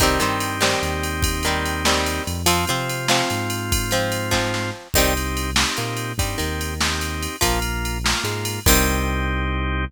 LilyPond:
<<
  \new Staff \with { instrumentName = "Acoustic Guitar (steel)" } { \time 6/8 \key c \minor \tempo 4. = 97 <ees g c'>8 <ees g c'>4 <ees g c'>4.~ | <ees g c'>8 <ees g c'>4 <ees g c'>4. | <f c'>8 <f c'>4 <f c'>4.~ | <f c'>8 <f c'>4 <f c'>4. |
<ees g c'>8 r4. bes4 | g8 ees2~ ees8 | <f bes>8 r4. aes4 | <ees g c'>2. | }
  \new Staff \with { instrumentName = "Drawbar Organ" } { \time 6/8 \key c \minor <c' ees' g'>2.~ | <c' ees' g'>2. | <c' f'>2.~ | <c' f'>2. |
<c' ees' g'>4. <c' ees' g'>4. | <c' ees' g'>4. <c' ees' g'>4. | <bes f'>4. <bes f'>4. | <c' ees' g'>2. | }
  \new Staff \with { instrumentName = "Synth Bass 1" } { \clef bass \time 6/8 \key c \minor c,8 g,4. ees,4~ | ees,2~ ees,8 f,8~ | f,8 c4. aes,4~ | aes,2. |
c,2 bes,4 | g,8 ees,2~ ees,8 | bes,,2 aes,4 | c,2. | }
  \new DrumStaff \with { instrumentName = "Drums" } \drummode { \time 6/8 <bd cymr>8 cymr8 cymr8 sn8 cymr8 cymr8 | <bd cymr>8 cymr8 cymr8 sn8 cymr8 cymr8 | cymr8 cymr8 cymr8 sn8 cymr8 cymr8 | <bd cymr>8 cymr8 cymr8 <bd sn>8 sn4 |
<cymc bd>8 cymr8 cymr8 sn8 cymr8 cymr8 | <bd cymr>8 cymr8 cymr8 sn8 cymr8 cymr8 | <bd cymr>8 cymr8 cymr8 sn8 cymr8 cymr8 | <cymc bd>4. r4. | }
>>